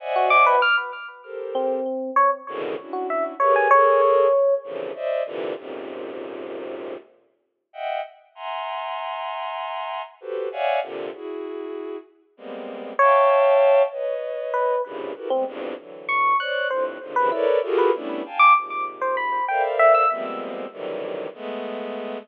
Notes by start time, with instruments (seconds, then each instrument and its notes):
0.00 violin C5 D5 D#5 E5 F#5 G#5
0.16 electric piano 1 F#4
0.30 electric piano 1 D6
0.46 electric piano 1 B4
0.62 electric piano 1 F6
1.24 violin G4 A4 A#4 C5
1.55 electric piano 1 C4
2.16 electric piano 1 C#5
2.47 violin G#2 A2 B2 C#3 D3 D#3
2.78 violin C#4 D4 E4 F#4
2.93 electric piano 1 F#4
3.10 electric piano 1 E5
3.40 violin G4 G#4 A#4 B4 C#5, electric piano 1 C#5
3.56 electric piano 1 G#5
3.71 violin G#4 A4 A#4, electric piano 1 C#5
4.64 violin A#2 C3 C#3 D3 E3 F3
4.95 violin C5 D5 D#5 E5
5.26 violin A#2 C3 D3 E3
5.57 violin F2 F#2 G#2 A#2 C3
7.73 violin D#5 E5 F#5 G5
8.35 violin E5 F#5 G#5 A#5 C6
10.21 violin F#4 G4 A4 B4 C5
10.52 violin C#5 D5 E5 F5 F#5 G#5
10.82 violin A#2 C3 D3
11.13 violin E4 F#4 G#4
12.37 violin G3 G#3 A#3 B3 C4
12.99 electric piano 1 C#5, violin E5 F5 G5 A5
13.92 violin B4 C#5 D#5
14.54 electric piano 1 B4
14.85 violin F#2 G2 G#2 A#2 C3 C#3
15.15 violin E4 F#4 G4 A4 A#4 B4
15.30 violin G3 G#3 A3 B3, electric piano 1 C4
15.46 violin E2 F2 G2
15.78 violin D3 E3 F#3
16.09 electric piano 1 C#6
16.39 violin C5 C#5 D5, electric piano 1 F#6
16.70 violin F2 G2 A2, electric piano 1 C5
17.01 violin G2 G#2 A#2 C3 C#3 D3
17.16 violin C3 C#3 D#3 F3, electric piano 1 B4
17.32 electric piano 1 E4, violin A4 A#4 B4 C#5 D5
17.63 violin F4 F#4 G4 G#4 A4 A#4
17.78 electric piano 1 B4
17.94 violin G3 A3 B3 C#4 D4 E4
18.25 violin F5 G5 G#5 A5
18.39 electric piano 1 D6
18.56 violin G#2 A#2 C3
19.01 electric piano 1 C5
19.17 electric piano 1 B5
19.48 violin A4 A#4 C5 D5 E5 F5, electric piano 1 G5
19.79 electric piano 1 E5
19.94 electric piano 1 E6
20.10 violin F3 G3 G#3 A#3 B3 C4
20.72 violin C3 D3 D#3 E3 F#3 G3
21.34 violin G#3 A3 B3